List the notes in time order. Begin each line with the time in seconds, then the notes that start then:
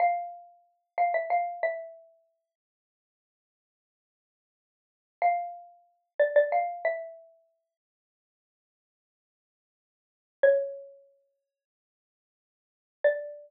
0.00 F5
0.98 F5
1.14 E5
1.30 F5
1.63 E5
5.22 F5
6.20 D5
6.36 D5
6.52 F5
6.85 E5
10.43 C#5
13.04 D5